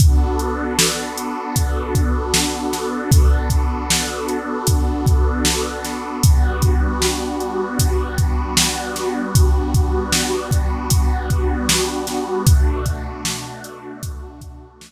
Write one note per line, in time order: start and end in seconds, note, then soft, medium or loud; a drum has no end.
0.00 6.18 B3 medium
0.00 6.18 D4 medium
0.00 6.18 F#4 medium
0.00 6.18 A4 medium
0.00 kick loud
0.00 closed hi-hat medium
0.39 closed hi-hat medium
0.79 snare loud
1.18 closed hi-hat medium
1.56 kick medium
1.56 closed hi-hat medium
1.95 kick medium
1.95 closed hi-hat medium
2.34 snare loud
2.73 snare medium
2.73 closed hi-hat medium
3.12 kick loud
3.12 closed hi-hat loud
3.50 kick medium
3.50 closed hi-hat medium
3.90 snare loud
4.28 closed hi-hat medium
4.67 kick medium
4.67 closed hi-hat medium
5.06 kick medium
5.06 closed hi-hat medium
5.45 snare medium
5.85 snare soft
5.85 closed hi-hat medium
6.23 12.41 G3 medium
6.23 12.41 B3 medium
6.23 12.41 D4 medium
6.23 12.41 F#4 medium
6.23 kick medium
6.23 closed hi-hat medium
6.62 kick medium
6.62 closed hi-hat medium
7.02 snare medium
7.40 closed hi-hat soft
7.79 kick medium
7.79 closed hi-hat medium
8.18 kick medium
8.18 closed hi-hat medium
8.57 snare loud
8.96 snare soft
8.96 closed hi-hat medium
9.35 kick medium
9.35 closed hi-hat medium
9.74 kick medium
9.74 closed hi-hat medium
10.13 snare loud
10.51 kick medium
10.51 closed hi-hat medium
10.90 kick medium
10.90 closed hi-hat medium
11.30 kick medium
11.30 closed hi-hat medium
11.69 snare loud
12.07 snare medium
12.07 closed hi-hat medium
12.47 14.92 B2 medium
12.47 14.92 A3 medium
12.47 14.92 D4 medium
12.47 14.92 F#4 medium
12.47 kick loud
12.47 closed hi-hat medium
12.86 kick medium
12.86 closed hi-hat medium
13.25 snare loud
13.64 closed hi-hat medium
14.03 kick medium
14.03 closed hi-hat medium
14.41 kick medium
14.41 closed hi-hat medium
14.81 snare loud